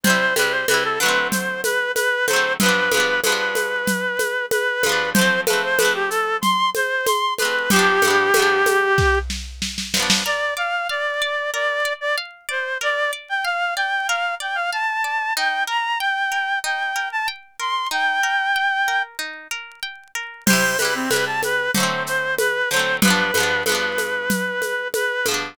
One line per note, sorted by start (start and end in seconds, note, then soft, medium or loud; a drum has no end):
0.03 0.34 C3 medium
0.03 0.34 G3 medium
0.03 0.35 C5 loud
0.03 low conga medium
0.03 shaker medium
0.10 0.34 E4 medium
0.36 0.65 C3 medium
0.36 0.65 G3 medium
0.36 0.52 B4 loud
0.36 high conga medium
0.36 shaker medium
0.42 0.65 E4 medium
0.51 0.66 C5 medium
0.68 0.99 C3 medium
0.68 0.99 G3 medium
0.68 0.83 B4 loud
0.68 high conga medium
0.68 shaker medium
0.74 0.99 E4 medium
0.84 0.99 A4 medium
1.00 2.20 D3 medium
1.00 2.20 F#3 medium
1.00 1.27 B4 loud
1.00 shaker medium
1.06 2.20 A3 medium
1.06 2.20 C4 medium
1.32 1.61 C5 medium
1.32 low conga medium
1.32 shaker medium
1.64 1.92 B4 loud
1.64 high conga medium
1.64 shaker medium
1.95 2.26 B4 loud
1.95 high conga medium
1.95 shaker medium
2.27 2.57 D3 medium
2.27 2.57 F#3 medium
2.27 2.53 C5 loud
2.27 high conga medium
2.27 shaker medium
2.33 2.57 A3 medium
2.33 2.57 C4 medium
2.60 2.90 G2 medium
2.60 2.90 F3 medium
2.60 3.20 B4 loud
2.60 low conga medium
2.60 shaker medium
2.66 2.90 B3 medium
2.66 2.90 D4 medium
2.91 3.21 G2 medium
2.91 3.21 F3 medium
2.91 high conga medium
2.91 shaker medium
2.97 3.21 B3 medium
2.97 3.21 D4 medium
3.24 4.71 G2 medium
3.24 4.71 F3 medium
3.24 4.46 B4 medium
3.24 high conga medium
3.24 shaker medium
3.29 4.71 B3 medium
3.29 4.71 D4 medium
3.55 high conga medium
3.55 shaker medium
3.87 low conga medium
3.87 shaker medium
4.19 high conga medium
4.19 shaker medium
4.51 5.10 B4 loud
4.51 high conga medium
4.51 shaker medium
4.83 5.13 G2 medium
4.83 5.13 F3 medium
4.83 high conga medium
4.83 shaker medium
4.89 5.13 B3 medium
4.89 5.13 D4 medium
5.14 5.45 F3 medium
5.14 5.41 C5 loud
5.14 low conga medium
5.14 shaker medium
5.19 5.45 A3 medium
5.19 5.45 C4 medium
5.47 5.77 F3 medium
5.47 5.77 A3 medium
5.47 5.62 B4 medium
5.47 high conga medium
5.47 shaker medium
5.53 5.77 C4 medium
5.63 5.78 C5 loud
5.78 7.26 F3 medium
5.78 5.93 B4 loud
5.78 high conga medium
5.78 shaker medium
5.82 7.26 A3 medium
5.82 7.26 C4 medium
5.94 6.09 G4 medium
6.10 6.37 A4 loud
6.10 shaker medium
6.41 6.70 C6 loud
6.41 low conga medium
6.41 shaker medium
6.75 7.06 C5 loud
6.75 high conga medium
6.75 shaker medium
7.06 7.34 C6 medium
7.06 high conga medium
7.06 shaker medium
7.38 7.69 F3 medium
7.38 7.69 A3 medium
7.38 7.70 B4 loud
7.38 high conga medium
7.38 shaker medium
7.45 7.69 C4 medium
7.70 8.00 G2 medium
7.70 8.00 F3 medium
7.70 9.19 G4 loud
7.70 low conga medium
7.70 shaker medium
7.76 8.00 B3 medium
7.76 8.00 D4 medium
8.02 8.31 G2 medium
8.02 8.31 F3 medium
8.02 high conga medium
8.02 shaker medium
8.08 8.31 B3 medium
8.08 8.31 D4 medium
8.34 9.81 G2 medium
8.34 9.81 F3 medium
8.34 high conga medium
8.34 shaker medium
8.39 9.81 B3 medium
8.39 9.81 D4 medium
8.66 high conga medium
8.66 shaker medium
8.98 kick medium
8.98 snare medium
9.30 snare medium
9.62 snare medium
9.78 snare medium
9.94 10.23 G2 medium
9.94 10.23 F3 medium
9.94 snare medium
10.00 10.23 B3 medium
10.00 10.23 D4 medium
10.10 snare medium
10.26 10.54 A#4 medium
10.26 10.54 D5 medium
10.57 10.86 D5 medium
10.57 10.87 F5 medium
10.89 11.50 D5 medium
10.89 11.18 F5 medium
11.22 11.50 D5 medium
11.54 11.82 A#4 medium
11.54 11.93 D5 loud
11.85 12.14 D5 medium
12.01 12.16 D5 loud
12.18 12.46 F5 medium
12.49 12.78 C5 medium
12.49 12.77 D5 medium
12.81 13.10 A#4 medium
12.81 13.11 D5 loud
13.13 13.41 D5 medium
13.29 13.44 G5 medium
13.45 13.73 F5 medium
13.45 13.74 F5 medium
13.76 14.05 D5 medium
13.76 14.07 G5 medium
14.08 14.38 A#4 medium
14.08 14.35 F5 medium
14.40 14.69 D5 medium
14.40 14.57 G5 medium
14.55 14.70 F5 medium
14.72 15.01 F5 medium
14.72 15.34 A5 medium
15.04 15.33 D5 medium
15.37 15.66 D#4 loud
15.37 15.64 G5 loud
15.67 15.96 A#4 medium
15.67 15.98 A#5 medium
16.00 16.59 G5 medium
16.00 16.29 G5 medium
16.32 16.60 A#4 medium
16.64 16.93 D#4 medium
16.64 17.08 G5 medium
16.96 17.24 A#4 medium
17.12 17.27 A5 medium
17.28 17.57 G5 medium
17.60 17.88 A#4 medium
17.60 17.88 C6 medium
17.91 18.20 D#4 medium
17.91 19.02 G5 loud
18.23 18.52 A#4 medium
18.56 18.85 G5 medium
18.88 19.17 A#4 medium
19.19 19.48 D#4 medium
19.51 19.80 A#4 medium
19.83 20.11 G5 medium
20.15 20.44 A#4 medium
20.46 20.77 C3 medium
20.46 20.77 G3 medium
20.46 20.77 C5 loud
20.46 crash medium
20.46 low conga medium
20.46 shaker medium
20.53 20.77 E4 medium
20.79 21.09 C3 medium
20.79 21.09 G3 medium
20.79 20.94 B4 medium
20.79 high conga medium
20.79 shaker medium
20.85 21.09 E4 medium
20.95 21.10 C4 medium
21.10 21.69 C3 medium
21.10 21.69 G3 medium
21.10 21.25 B4 loud
21.10 high conga medium
21.10 shaker medium
21.16 21.69 E4 medium
21.26 21.41 A5 medium
21.43 21.71 B4 loud
21.43 high conga medium
21.43 shaker medium
21.74 22.63 D3 medium
21.74 22.63 F#3 medium
21.74 22.03 C5 medium
21.74 low conga medium
21.74 shaker medium
21.80 22.63 A3 medium
21.80 22.63 C4 medium
22.07 22.35 C5 medium
22.07 shaker medium
22.38 22.69 B4 loud
22.38 high conga medium
22.38 shaker medium
22.70 23.00 D3 medium
22.70 23.00 F#3 medium
22.70 22.96 C5 loud
22.70 shaker medium
22.76 23.00 A3 medium
22.76 23.00 C4 medium
23.02 23.31 G2 medium
23.02 23.31 F3 medium
23.02 23.63 B4 loud
23.02 low conga medium
23.02 shaker medium
23.08 23.31 B3 medium
23.08 23.31 D4 loud
23.34 23.64 G2 medium
23.34 23.64 F3 medium
23.34 high conga medium
23.34 shaker medium
23.40 23.64 B3 medium
23.40 23.64 D4 medium
23.66 25.13 G2 medium
23.66 25.13 F3 medium
23.66 24.88 B4 medium
23.66 high conga medium
23.66 shaker medium
23.72 25.13 B3 medium
23.72 25.13 D4 medium
23.98 high conga medium
23.98 shaker medium
24.30 low conga medium
24.30 shaker medium
24.62 high conga soft
24.62 shaker soft
24.94 25.26 B4 medium
24.94 high conga medium
24.94 shaker medium
25.26 25.55 G2 medium
25.26 25.55 F3 medium
25.26 high conga medium
25.26 shaker medium
25.31 25.55 B3 medium
25.31 25.55 D4 medium